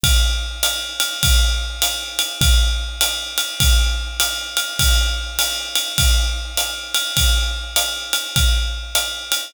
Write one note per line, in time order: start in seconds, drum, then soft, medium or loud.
0.03 kick medium
0.03 ride loud
0.63 hi-hat pedal medium
0.63 ride medium
1.00 ride medium
1.23 kick medium
1.23 ride loud
1.82 hi-hat pedal medium
1.82 ride medium
2.19 ride medium
2.41 kick medium
2.41 ride loud
3.01 hi-hat pedal medium
3.01 ride medium
3.38 ride medium
3.60 kick medium
3.60 ride loud
4.20 hi-hat pedal medium
4.20 ride medium
4.57 ride medium
4.79 kick medium
4.79 ride loud
5.39 hi-hat pedal medium
5.39 ride medium
5.75 ride medium
5.98 kick medium
5.98 ride loud
6.57 hi-hat pedal medium
6.57 ride medium
6.95 ride medium
7.17 kick medium
7.17 ride loud
7.76 hi-hat pedal medium
7.76 ride medium
8.13 ride medium
8.36 kick medium
8.36 ride medium
8.95 hi-hat pedal medium
8.95 ride medium
9.32 ride medium